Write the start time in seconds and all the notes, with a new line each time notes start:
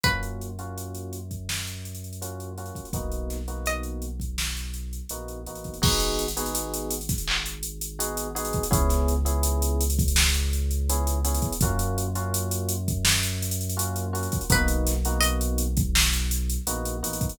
0.03 F#2 A#3 C#4 F4 F#4 B4, kick, closed hi-hat
0.23 closed hi-hat
0.41 closed hi-hat
0.59 A#3 C#4 F4 F#4, closed hi-hat
0.78 closed hi-hat
0.94 closed hi-hat
1.13 closed hi-hat
1.31 kick, closed hi-hat
1.49 snare
1.67 closed hi-hat
1.85 closed hi-hat
1.95 closed hi-hat
2.04 closed hi-hat
2.13 closed hi-hat
2.21 A#3 C#4 F4 F#4, closed hi-hat
2.40 closed hi-hat
2.58 A#3 C#4 F4 F#4, closed hi-hat
2.66 closed hi-hat
2.75 kick, closed hi-hat
2.85 closed hi-hat
2.93 B1 A#3 B3 D#4 F#4, kick, closed hi-hat
3.11 closed hi-hat
3.30 snare, closed hi-hat
3.48 A#3 B3 D#4 F#4, closed hi-hat
3.66 D#5, closed hi-hat
3.83 closed hi-hat
4.02 closed hi-hat
4.20 kick, closed hi-hat
4.38 snare
4.56 closed hi-hat
4.74 closed hi-hat
4.93 closed hi-hat
5.09 A#1 A#3 B3 D#4 F#4, closed hi-hat
5.28 closed hi-hat
5.46 A1 A#3 B3 D#4 F#4, closed hi-hat
5.55 closed hi-hat
5.64 kick, closed hi-hat
5.74 closed hi-hat
5.82 G#1 B3 D#4 F#4 G#4, kick, crash
6.00 closed hi-hat
6.19 closed hi-hat
6.28 closed hi-hat
6.37 B3 D#4 F#4 G#4, closed hi-hat
6.46 closed hi-hat
6.55 closed hi-hat
6.73 closed hi-hat
6.91 closed hi-hat
7.01 closed hi-hat
7.09 kick, snare, closed hi-hat
7.18 closed hi-hat
7.27 clap
7.46 closed hi-hat
7.63 closed hi-hat
7.81 closed hi-hat
7.99 B3 D#4 F#4 G#4, closed hi-hat
8.17 closed hi-hat
8.35 B3 D#4 F#4 G#4, closed hi-hat
8.45 closed hi-hat
8.53 kick, closed hi-hat
8.63 closed hi-hat
8.71 C#2 B3 C#4 E4 G#4, kick, closed hi-hat
8.89 snare, closed hi-hat
9.08 closed hi-hat
9.25 B3 C#4 E4 G#4, closed hi-hat
9.43 closed hi-hat
9.62 closed hi-hat
9.81 closed hi-hat
9.90 closed hi-hat
9.99 kick, closed hi-hat
10.08 closed hi-hat
10.16 snare
10.34 closed hi-hat
10.53 closed hi-hat
10.71 closed hi-hat
10.89 B3 C#4 E4 G#4, closed hi-hat
11.07 closed hi-hat
11.24 B3 C#4 E4 G#4, closed hi-hat
11.34 closed hi-hat
11.42 kick, closed hi-hat
11.52 closed hi-hat
11.61 F#2 A#3 C#4 F4 F#4, kick, closed hi-hat
11.79 closed hi-hat
11.98 closed hi-hat
12.15 A#3 C#4 F4 F#4, closed hi-hat
12.34 closed hi-hat
12.51 closed hi-hat
12.69 closed hi-hat
12.88 kick, closed hi-hat
13.05 snare
13.23 closed hi-hat
13.42 closed hi-hat
13.51 closed hi-hat
13.61 closed hi-hat
13.69 closed hi-hat
13.77 A#3 C#4 F4 F#4, closed hi-hat
13.96 closed hi-hat
14.13 A#3 C#4 F4 F#4, closed hi-hat
14.23 closed hi-hat
14.32 kick, closed hi-hat
14.41 closed hi-hat
14.50 B1 A#3 B3 D#4 F#4 B4, kick, closed hi-hat
14.68 closed hi-hat
14.86 snare, closed hi-hat
15.05 A#3 B3 D#4 F#4, closed hi-hat
15.20 D#5, closed hi-hat
15.41 closed hi-hat
15.58 closed hi-hat
15.77 kick, closed hi-hat
15.95 snare
16.13 closed hi-hat
16.31 closed hi-hat
16.49 closed hi-hat
16.67 A#1 A#3 B3 D#4 F#4, closed hi-hat
16.85 closed hi-hat
17.03 A1 A#3 B3 D#4 F#4, closed hi-hat
17.13 closed hi-hat
17.21 kick, closed hi-hat
17.29 closed hi-hat